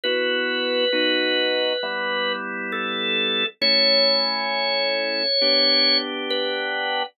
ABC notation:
X:1
M:4/4
L:1/8
Q:1/4=67
K:D
V:1 name="Drawbar Organ"
B6 A2 | c6 B2 |]
V:2 name="Drawbar Organ"
[B,EF]2 [B,^DF]2 [G,B,E]4 | [A,CE]4 [B,DG]4 |]